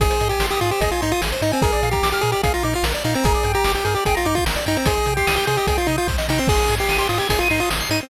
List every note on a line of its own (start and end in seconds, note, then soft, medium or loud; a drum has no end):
0.00 0.10 G#1 medium
0.00 0.10 G#4 medium
0.00 0.28 G#4 loud
0.00 kick loud
0.00 closed hi-hat loud
0.10 0.19 C5 medium
0.10 closed hi-hat loud
0.20 0.32 G#2 medium
0.20 0.30 D#5 medium
0.20 closed hi-hat loud
0.29 0.46 G4 medium
0.29 0.40 G#5 medium
0.29 closed hi-hat medium
0.39 0.50 G#1 medium
0.39 0.50 C6 medium
0.39 snare loud
0.50 0.60 G4 medium
0.50 0.61 D#6 medium
0.50 closed hi-hat medium
0.61 0.72 G#2 medium
0.61 0.71 F4 medium
0.61 0.70 G#4 medium
0.61 closed hi-hat medium
0.71 0.81 G4 medium
0.71 0.80 C5 medium
0.71 closed hi-hat medium
0.81 0.92 G#1 medium
0.81 0.91 G#4 medium
0.81 0.90 D#5 medium
0.81 kick loud
0.81 closed hi-hat loud
0.91 1.01 F4 medium
0.91 1.01 G#5 medium
0.91 closed hi-hat medium
1.01 1.14 G#2 medium
1.01 1.12 D#4 medium
1.01 1.10 C6 medium
1.01 closed hi-hat loud
1.12 1.21 F4 medium
1.12 1.21 D#6 medium
1.12 closed hi-hat medium
1.21 1.33 G#1 medium
1.21 1.31 G#4 medium
1.21 snare loud
1.32 1.41 C5 medium
1.32 closed hi-hat medium
1.42 1.53 G#2 medium
1.42 1.52 D#4 medium
1.42 1.51 D#5 medium
1.42 closed hi-hat medium
1.52 1.63 C4 medium
1.52 1.61 G#5 medium
1.52 closed hi-hat medium
1.62 1.74 A#1 medium
1.62 1.89 G#4 medium
1.62 1.71 A#4 medium
1.62 kick loud
1.62 closed hi-hat loud
1.72 1.81 D5 medium
1.72 closed hi-hat medium
1.83 1.94 A#2 medium
1.83 1.92 F5 medium
1.83 closed hi-hat medium
1.91 2.09 G4 medium
1.91 2.02 A#5 medium
1.91 kick loud
1.91 closed hi-hat medium
2.03 2.14 A#1 medium
2.03 2.12 D6 medium
2.03 snare loud
2.11 2.22 G4 medium
2.11 2.22 F6 medium
2.11 closed hi-hat medium
2.21 2.34 A#2 medium
2.21 2.31 G#4 loud
2.21 2.32 A#4 medium
2.21 closed hi-hat medium
2.32 2.42 G4 medium
2.32 2.42 D5 medium
2.32 closed hi-hat medium
2.43 2.56 A#1 medium
2.43 2.53 G#4 medium
2.43 2.53 F5 medium
2.43 kick loud
2.43 closed hi-hat loud
2.54 2.63 F4 medium
2.54 2.63 A#5 medium
2.54 closed hi-hat medium
2.63 2.75 A#2 medium
2.63 2.74 D#4 medium
2.63 2.72 D6 medium
2.63 closed hi-hat medium
2.73 2.85 F4 medium
2.73 2.83 F6 medium
2.73 closed hi-hat medium
2.83 2.94 A#1 medium
2.83 2.93 A#4 medium
2.83 snare loud
2.94 3.03 D5 medium
2.94 closed hi-hat medium
3.04 3.16 A#2 medium
3.04 3.15 D#4 medium
3.04 3.13 F5 medium
3.04 closed hi-hat medium
3.14 3.25 C4 medium
3.14 3.23 A#5 medium
3.14 closed hi-hat loud
3.24 3.35 G1 medium
3.24 3.52 G#4 medium
3.24 3.33 A#4 loud
3.24 kick loud
3.24 closed hi-hat loud
3.34 3.44 D5 medium
3.34 closed hi-hat medium
3.43 3.56 G2 medium
3.43 3.54 G5 medium
3.43 closed hi-hat loud
3.54 3.72 G4 loud
3.54 3.64 A#5 medium
3.54 closed hi-hat medium
3.64 3.76 G1 medium
3.64 3.74 D6 medium
3.64 snare loud
3.75 3.84 G4 medium
3.75 3.84 G6 medium
3.75 closed hi-hat loud
3.85 3.96 G2 medium
3.85 3.94 G#4 medium
3.85 3.95 A#4 medium
3.85 closed hi-hat medium
3.95 4.04 G4 medium
3.95 4.05 D5 medium
3.95 closed hi-hat medium
4.05 4.18 G1 medium
4.05 4.16 G#4 medium
4.05 4.14 G5 medium
4.05 kick loud
4.05 closed hi-hat loud
4.15 4.27 F4 medium
4.15 4.24 A#5 medium
4.15 closed hi-hat medium
4.25 4.37 G2 medium
4.25 4.36 D#4 medium
4.25 4.34 D6 medium
4.25 closed hi-hat medium
4.35 4.45 F4 medium
4.35 4.45 G6 medium
4.35 kick loud
4.35 closed hi-hat medium
4.46 4.57 G1 medium
4.46 4.55 A#4 medium
4.46 snare loud
4.56 4.65 D5 medium
4.56 closed hi-hat medium
4.66 4.78 G2 medium
4.66 4.77 D#4 medium
4.66 4.75 G5 medium
4.66 closed hi-hat medium
4.76 4.86 C4 medium
4.76 4.86 A#5 medium
4.76 closed hi-hat medium
4.86 4.98 C2 medium
4.86 5.14 G#4 medium
4.86 4.95 C5 medium
4.86 kick loud
4.86 closed hi-hat loud
4.97 5.06 D#5 medium
4.97 closed hi-hat medium
5.06 5.18 C3 medium
5.06 5.16 G5 medium
5.06 closed hi-hat medium
5.17 5.35 G4 medium
5.17 5.26 C6 medium
5.17 kick medium
5.17 closed hi-hat medium
5.27 5.38 C2 medium
5.27 5.36 D#6 medium
5.27 snare loud
5.36 5.46 G4 medium
5.36 5.46 G6 medium
5.36 closed hi-hat medium
5.47 5.59 C3 medium
5.47 5.57 G#4 loud
5.47 5.56 C5 medium
5.47 closed hi-hat loud
5.57 5.67 G4 medium
5.57 5.67 D#5 medium
5.57 closed hi-hat medium
5.67 5.78 C2 medium
5.67 5.77 G#4 medium
5.67 5.77 G5 medium
5.67 kick loud
5.67 closed hi-hat loud
5.77 5.87 F4 medium
5.77 5.87 C6 medium
5.77 closed hi-hat medium
5.87 5.99 C3 medium
5.87 5.96 D#4 medium
5.87 5.97 D#6 medium
5.87 closed hi-hat loud
5.98 6.08 F4 medium
5.98 6.07 G6 medium
5.98 closed hi-hat medium
6.08 6.19 C2 medium
6.08 6.17 C5 medium
6.08 kick loud
6.08 snare loud
6.18 6.27 D#5 medium
6.18 snare loud
6.29 6.40 C3 medium
6.29 6.39 D#4 medium
6.29 6.38 G5 medium
6.29 snare loud
6.38 6.49 C4 medium
6.38 6.47 C6 medium
6.47 6.59 G#1 medium
6.47 6.75 G#4 loud
6.47 6.59 C6 medium
6.47 kick loud
6.47 crash loud
6.58 6.68 D#6 medium
6.58 closed hi-hat medium
6.68 6.80 G#2 medium
6.68 6.78 G#6 medium
6.68 closed hi-hat loud
6.78 6.97 G4 medium
6.78 6.88 C7 medium
6.78 closed hi-hat medium
6.89 7.00 G#1 medium
6.89 6.98 D#7 medium
6.89 snare loud
6.98 7.08 G4 medium
6.98 7.08 C6 medium
6.98 closed hi-hat medium
7.09 7.20 G#2 medium
7.09 7.19 F4 medium
7.09 7.18 D#6 medium
7.09 closed hi-hat medium
7.18 7.28 G4 medium
7.18 7.29 G#6 medium
7.18 closed hi-hat medium
7.29 7.41 G#1 medium
7.29 7.39 G#4 medium
7.29 7.39 C7 medium
7.29 kick loud
7.29 closed hi-hat loud
7.39 7.48 F4 medium
7.39 7.50 D#7 medium
7.39 closed hi-hat medium
7.50 7.62 G#2 medium
7.50 7.60 D#4 medium
7.50 7.59 C6 medium
7.50 closed hi-hat loud
7.60 7.70 F4 medium
7.60 7.69 D#6 medium
7.60 closed hi-hat medium
7.70 7.82 G#1 medium
7.70 7.79 G#6 medium
7.70 snare loud
7.80 7.90 C7 medium
7.80 closed hi-hat medium
7.90 8.01 G#2 medium
7.90 8.00 D#4 medium
7.90 8.00 D#7 medium
7.90 closed hi-hat medium
8.00 8.09 C4 medium
8.00 8.09 C6 medium
8.00 closed hi-hat medium